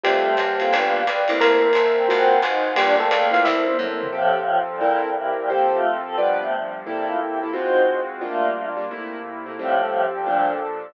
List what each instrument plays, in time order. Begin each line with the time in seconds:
0.03 electric bass (finger) F2, electric piano 1 G3 G4, choir aahs A3, acoustic grand piano C4 F4 G4 A4, pad 2 (warm) C5 F5 G5 A5, ride
0.37 electric bass (finger) F#2, choir aahs A#3, kick, hi-hat pedal, ride
0.60 acoustic grand piano C4 F4 G4 A4, ride
0.71 electric bass (finger) G1, pad 2 (warm) B4 D5 F5 G5, kick, ride
0.75 acoustic grand piano B3 D4 F4 G4
1.05 electric bass (finger) A#1, kick, hi-hat pedal, ride
1.28 electric bass (finger) C2, acoustic grand piano A3 A#3 C4 E4, ride
1.41 electric piano 1 A#3 A#4, pad 2 (warm) A#4 C5 E5 A5, ride
1.73 electric bass (finger) G1, hi-hat pedal, ride
1.97 choir aahs C4
2.08 electric bass (finger) G#1, acoustic grand piano G#3 C4 F4 F#4, choir aahs C4, pad 2 (warm) C5 F5 F#5 G#5, ride
2.42 electric bass (finger) G#1, choir aahs D#4, hi-hat pedal, ride
2.75 electric bass (finger) G1, acoustic grand piano G3 A#3 D4 F4, electric piano 1 G3 G4, choir aahs D4, pad 2 (warm) A#4 D5 F5 G5, ride
2.99 electric piano 1 A3 A4, choir aahs C4
3.11 electric bass (finger) C#2, choir aahs A#3, hi-hat pedal, ride
3.31 acoustic grand piano A3 A#3 C4 E4, electric piano 1 F4 F5, ride
3.44 electric bass (finger) C2, electric piano 1 E4 E5, pad 2 (warm) A4 A#4 C5 E5, kick, snare
3.68 high tom
3.78 electric bass (finger) F#2, acoustic grand piano A3 A#3 C4 E4, mid tom
4.02 floor tom
4.12 choir aahs A2 F3, acoustic grand piano F3 C4 G4 A4, pad 2 (warm) F3 C4 G4 A4
4.48 pad 2 (warm) F3 C4 F4 A4
4.70 choir aahs A#2 G3
4.80 pad 2 (warm) C4 E4 A4 A#4, acoustic grand piano C4 E4 A4 A#4
5.04 choir aahs A#2 G3
5.15 choir aahs G2 E3, pad 2 (warm) C4 E4 G4 A#4
5.38 choir aahs A#2 G3
5.49 pad 2 (warm) F3 C4 G4 A4, acoustic grand piano F3 G4 A4 C5, choir aahs A#3 G4
5.72 choir aahs A3 F4
5.82 pad 2 (warm) F3 C4 F4 A4
6.06 choir aahs C4 A4
6.18 pad 2 (warm) G2 F3 B3 D4, choir aahs B2 G3, acoustic grand piano G3 F4 B4 D5
6.40 choir aahs C3 A3
6.52 pad 2 (warm) G2 F3 G3 D4
6.86 acoustic grand piano C3 A#3 E4 A4, pad 2 (warm) C3 A#3 E4 A4, choir aahs G3 E4
7.08 choir aahs A3 F4
7.20 choir aahs G4 E5
7.43 acoustic grand piano C3 A#3 E4 A4
7.53 acoustic grand piano G#3 C4 F4 F#4, pad 2 (warm) G#3 C4 F4 F#4, choir aahs D#4 C5
8.21 acoustic grand piano G3 A#3 D4 F4, pad 2 (warm) G3 A#3 D4 F4, choir aahs A3 F4
8.77 acoustic grand piano G3 A#3 D4 F4
8.90 pad 2 (warm) C3 A3 A#3 E4, acoustic grand piano C3 A3 A#3 E4
9.46 acoustic grand piano C3 A3 A#3 E4
9.58 choir aahs A2 F3, pad 2 (warm) F3 C4 G4 A4, acoustic grand piano F3 G3 A3 C4
9.81 acoustic grand piano F3 G3 A3 C4
10.15 choir aahs A#2 G3
10.26 pad 2 (warm) A#2 F3 D4 A4, acoustic grand piano A#2 F3 A3 D4